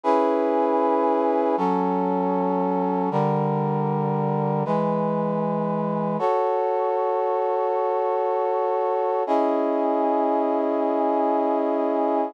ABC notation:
X:1
M:4/4
L:1/8
Q:1/4=78
K:C#m
V:1 name="Brass Section"
[CEGB]4 [F,CA]4 | [=D,=G,_B]4 [E,^G,=B]4 | [K:F#m] [FAc]8 | [CEG^d]8 |]